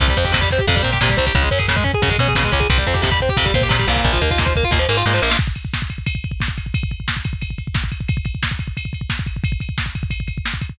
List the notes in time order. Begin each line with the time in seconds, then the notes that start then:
0.00 C2 C3, kick, crash
0.08 G3, kick
0.17 F2 C4, kick, closed hi-hat
0.25 G4, kick
0.32 C3, kick, snare
0.41 G3, kick
0.51 C4, kick, snare
0.58 G4, kick
0.67 F2 C3, kick, closed hi-hat
0.75 G3, kick
0.83 A#2 C4, kick, closed hi-hat
0.92 G4, kick
1.01 A#2 C3, kick, snare
1.09 G3, kick
1.17 C2 C4, kick, closed hi-hat
1.27 G4, kick
1.35 C#2 C#3, kick, closed hi-hat
1.42 G#3, kick
1.51 F#2 C#4, kick, closed hi-hat
1.59 G#4, kick
1.68 C#3, kick, snare
1.76 G#3, kick
1.84 C#4, kick, closed hi-hat
1.94 G#4, kick
2.02 F#2 C#3, kick, closed hi-hat
2.09 G#3, kick
2.18 B2 C#4, kick, closed hi-hat
2.28 G#4, kick
2.35 B2 C#3, kick, snare
2.43 G#3, kick
2.52 C#2 C#4, kick, open hi-hat
2.60 G#4, kick
2.70 C2 C3, kick, closed hi-hat
2.78 G3, kick
2.86 F2 C4, kick, closed hi-hat
2.94 G4, kick
3.02 C3, kick, snare
3.11 G3, kick
3.19 C4, kick, closed hi-hat
3.29 G4, kick
3.37 F2 C3, kick, closed hi-hat
3.45 G3, kick
3.54 A#2 C4, kick, closed hi-hat
3.61 G4, kick
3.69 A#2 C3, kick, snare
3.79 G3, kick
3.87 C2 A#2, kick, closed hi-hat
3.96 kick
4.04 A#1, kick, closed hi-hat
4.13 F3, kick
4.21 D#2 A#3, kick, closed hi-hat
4.31 F4, kick
4.38 A#2, kick, snare
4.46 F3, kick
4.55 A#3, kick, closed hi-hat
4.63 F4, kick
4.71 D#2 A#2, kick, snare
4.79 F3
4.89 G#2 A#3, snare
4.97 F4
5.06 G#2 A#2, snare
5.14 F3, snare
5.22 A#1 A#3, snare
5.29 F4, snare
5.39 kick, crash
5.47 kick
5.55 kick, ride
5.65 kick
5.74 kick, snare
5.82 kick
5.90 kick, ride
5.98 kick
6.06 kick, ride
6.15 kick
6.24 kick, ride
6.31 kick
6.40 kick, snare
6.48 kick
6.58 kick, ride
6.66 kick
6.74 kick, ride
6.83 kick
6.91 kick, ride
7.00 kick
7.08 kick, snare
7.17 kick
7.24 kick, ride
7.33 kick
7.42 kick, ride
7.50 kick
7.58 kick, ride
7.67 kick
7.74 kick, snare
7.84 kick
7.92 kick, ride
8.00 kick
8.08 kick, ride
8.17 kick
8.25 kick, ride
8.35 kick
8.43 kick, snare
8.51 kick
8.59 kick, ride
8.68 kick
8.77 kick, ride
8.85 kick
8.93 kick, ride
9.01 kick
9.10 kick, snare
9.19 kick
9.26 kick, ride
9.36 kick
9.44 kick, ride
9.52 kick
9.60 kick, ride
9.69 kick
9.78 kick, snare
9.86 kick
9.95 kick, ride
10.03 kick
10.10 kick, ride
10.20 kick
10.28 kick, ride
10.38 kick
10.45 snare
10.54 kick
10.61 kick, ride
10.69 kick